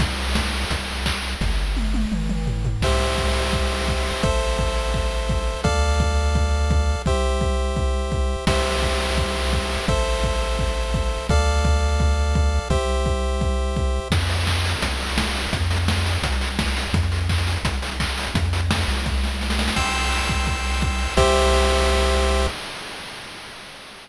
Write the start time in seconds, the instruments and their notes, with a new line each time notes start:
0.00 synth bass 1 C2, kick, crash
0.35 kick, snare
0.71 synth bass 1 C2, kick, closed hi-hat
1.06 kick, clap
1.41 synth bass 1 G1, kick, snare
1.76 high tom
1.94 high tom
2.12 synth bass 1 G1, mid tom
2.29 mid tom
2.47 floor tom
2.65 floor tom
2.81 synth bass 1 C2, lead 1 (square) G4 C5 E5, kick, crash
3.18 kick
3.53 kick
3.88 kick
4.23 synth bass 1 A1, lead 1 (square) A4 C5 E5, kick
4.59 kick
4.94 kick
5.29 kick
5.64 synth bass 1 D2, lead 1 (square) A4 D5 F5, kick
6.00 kick
6.35 kick
6.71 kick
7.06 synth bass 1 C2, lead 1 (square) G4 C5 E5, kick
7.41 kick
7.76 kick
8.12 kick
8.47 synth bass 1 C2, lead 1 (square) G4 C5 E5, kick, crash
8.82 kick
9.18 kick
9.53 kick
9.88 synth bass 1 A1, lead 1 (square) A4 C5 E5, kick
10.24 kick
10.59 kick
10.94 kick
11.29 synth bass 1 D2, lead 1 (square) A4 D5 F5, kick
11.65 kick
12.00 kick
12.35 kick
12.70 synth bass 1 C2, lead 1 (square) G4 C5 E5, kick
13.06 kick
13.41 kick
13.76 kick
14.10 synth bass 1 F2, kick, crash
14.21 closed hi-hat
14.29 open hi-hat
14.38 closed hi-hat
14.47 kick, clap
14.56 closed hi-hat
14.65 open hi-hat
14.74 closed hi-hat
14.82 synth bass 1 C2, kick, closed hi-hat
14.91 closed hi-hat
15.00 open hi-hat
15.09 closed hi-hat
15.18 kick, snare
15.26 closed hi-hat
15.35 open hi-hat
15.44 closed hi-hat
15.53 synth bass 1 F2, kick, closed hi-hat
15.62 closed hi-hat
15.71 open hi-hat
15.79 closed hi-hat
15.88 kick, snare
15.97 closed hi-hat
16.06 open hi-hat
16.15 closed hi-hat
16.22 synth bass 1 C2, kick, closed hi-hat
16.32 closed hi-hat
16.41 open hi-hat
16.50 closed hi-hat
16.59 kick, snare
16.68 closed hi-hat
16.76 open hi-hat
16.85 closed hi-hat
16.93 synth bass 1 F2, kick, closed hi-hat
17.03 closed hi-hat
17.12 open hi-hat
17.21 closed hi-hat
17.29 kick, clap
17.38 closed hi-hat
17.47 open hi-hat
17.56 closed hi-hat
17.63 synth bass 1 C2, kick, closed hi-hat
17.74 closed hi-hat
17.82 open hi-hat
17.91 closed hi-hat
18.00 kick, clap
18.09 closed hi-hat
18.18 open hi-hat
18.26 closed hi-hat
18.34 synth bass 1 F2, kick, closed hi-hat
18.44 closed hi-hat
18.53 open hi-hat
18.62 closed hi-hat
18.71 kick, snare
18.79 closed hi-hat
18.88 synth bass 1 C2, open hi-hat
18.97 closed hi-hat
19.06 kick, snare
19.24 snare
19.41 snare
19.50 snare
19.59 snare
19.68 snare
19.76 synth bass 1 C2, lead 1 (square) G5 C6 E6, kick, crash
20.29 kick
20.47 kick
20.82 kick
21.17 synth bass 1 C2, lead 1 (square) G4 C5 E5, kick, crash